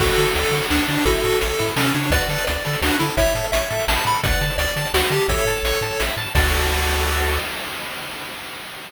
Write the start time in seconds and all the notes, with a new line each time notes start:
0.00 D2 F#4 A4, kick, crash
0.09 closed hi-hat
0.18 D3 A4, closed hi-hat
0.27 closed hi-hat
0.35 D2 A4 D5, closed hi-hat
0.44 closed hi-hat
0.51 D3 F#4, closed hi-hat
0.62 closed hi-hat
0.70 D2 D4 A4, snare
0.79 closed hi-hat
0.88 D3 D4 D5, closed hi-hat
0.97 open hi-hat
1.05 A1 E4 F#4 A4, kick, closed hi-hat
1.15 closed hi-hat
1.24 A2 A4, closed hi-hat
1.32 closed hi-hat
1.40 A1 A4 C#5, closed hi-hat
1.50 closed hi-hat
1.59 A2 E4, closed hi-hat
1.68 closed hi-hat
1.76 C3 C#4 A4, snare
1.85 closed hi-hat
1.94 C#3 D4 C#5, closed hi-hat
2.03 closed hi-hat
2.10 D2 F#4 B4 D5, kick, closed hi-hat
2.21 closed hi-hat
2.28 D3 A4, closed hi-hat
2.38 closed hi-hat
2.47 D2 D5, closed hi-hat
2.56 closed hi-hat
2.65 D3 A4, closed hi-hat
2.73 closed hi-hat
2.82 D2 D4 F#4, snare
2.91 closed hi-hat
2.99 D3 E4 A4, closed hi-hat
3.09 closed hi-hat
3.17 A1 E4 C#5 E5, kick, closed hi-hat
3.27 closed hi-hat
3.35 A2 A4, closed hi-hat
3.44 closed hi-hat
3.52 A1 C#5 E5, closed hi-hat
3.62 closed hi-hat
3.70 A2 A4, closed hi-hat
3.79 closed hi-hat
3.88 A1 E4 A5, snare
3.97 closed hi-hat
4.05 A2 A4 B5, closed hi-hat
4.14 closed hi-hat
4.24 D2 B4 D5 F#5, kick, closed hi-hat
4.32 closed hi-hat
4.41 D3 A5, closed hi-hat
4.50 closed hi-hat
4.58 D2 D5 D6, closed hi-hat
4.68 closed hi-hat
4.76 D3 A5, closed hi-hat
4.85 closed hi-hat
4.94 D2 F#4 F#5, snare
5.03 closed hi-hat
5.10 D3 G4 A5, closed hi-hat
5.21 closed hi-hat
5.28 A1 A4 C#5 E5, kick, closed hi-hat
5.38 closed hi-hat
5.45 A2 A5, closed hi-hat
5.56 closed hi-hat
5.63 A1 C#6, closed hi-hat
5.73 closed hi-hat
5.81 A2 A5, closed hi-hat
5.91 closed hi-hat
6.00 A1 E5, snare
6.09 closed hi-hat
6.17 A2 A5, closed hi-hat
6.26 closed hi-hat
6.35 D2 F#4 A4 D5, kick, crash